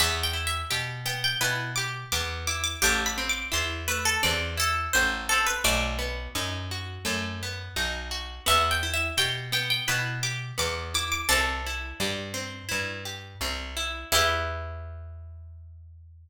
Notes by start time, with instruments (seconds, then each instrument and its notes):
0.00 electric bass (finger) E2, acoustic guitar (steel) B3, pizzicato strings E5
0.23 pizzicato strings G5
0.33 acoustic guitar (steel) E4
0.47 pizzicato strings E5
0.70 electric bass (finger) B2, acoustic guitar (steel) G4, pizzicato strings G5
1.06 acoustic guitar (steel) B3, pizzicato strings G5
1.24 pizzicato strings G5
1.41 electric bass (finger) B2, acoustic guitar (steel) E4, pizzicato strings B4
1.76 acoustic guitar (steel) G4, pizzicato strings D6
2.12 electric bass (finger) E2, acoustic guitar (steel) B3, pizzicato strings D6
2.47 acoustic guitar (steel) E4, pizzicato strings D6
2.64 pizzicato strings D6
2.82 electric bass (finger) A1, acoustic guitar (steel) A3, pizzicato strings G4
3.06 pizzicato strings B5
3.18 acoustic guitar (steel) C4
3.29 pizzicato strings D6
3.52 electric bass (finger) E2, acoustic guitar (steel) E4, pizzicato strings C6
3.88 acoustic guitar (steel) A3, pizzicato strings B4
4.05 pizzicato strings A4
4.23 electric bass (finger) E2, acoustic guitar (steel) C4, pizzicato strings D5
4.57 acoustic guitar (steel) E4, pizzicato strings A4
4.93 electric bass (finger) A1, acoustic guitar (steel) A3, pizzicato strings C5
5.29 acoustic guitar (steel) C4, pizzicato strings A4
5.46 pizzicato strings B4
5.64 electric bass (finger) B1, acoustic guitar (steel) A3, pizzicato strings D5
5.99 acoustic guitar (steel) B3
6.35 electric bass (finger) F#2, acoustic guitar (steel) D#4
6.71 acoustic guitar (steel) F#4
7.05 electric bass (finger) F#2, acoustic guitar (steel) A3
7.43 acoustic guitar (steel) B3
7.76 electric bass (finger) B1, acoustic guitar (steel) D#4
8.11 acoustic guitar (steel) F#4
8.46 electric bass (finger) E2, acoustic guitar (steel) B3, pizzicato strings E5
8.71 pizzicato strings G5
8.83 acoustic guitar (steel) E4
8.94 pizzicato strings E5
9.17 electric bass (finger) B2, acoustic guitar (steel) G4, pizzicato strings G5
9.52 acoustic guitar (steel) B3, pizzicato strings G5
9.70 pizzicato strings G5
9.88 electric bass (finger) B2, acoustic guitar (steel) E4, pizzicato strings B4
10.23 acoustic guitar (steel) G4, pizzicato strings D6
10.58 electric bass (finger) E2, acoustic guitar (steel) B3, pizzicato strings D6
10.94 acoustic guitar (steel) E4, pizzicato strings D6
11.12 pizzicato strings D6
11.29 electric bass (finger) C2, acoustic guitar (steel) C4, pizzicato strings A4
11.66 acoustic guitar (steel) E4
12.00 electric bass (finger) G2, acoustic guitar (steel) G4
12.34 acoustic guitar (steel) C4
12.69 electric bass (finger) G2, acoustic guitar (steel) E4
13.05 acoustic guitar (steel) G4
13.41 electric bass (finger) C2, acoustic guitar (steel) C4
13.77 acoustic guitar (steel) E4
14.12 electric bass (finger) E2, acoustic guitar (steel) B3 E4 G4, pizzicato strings E4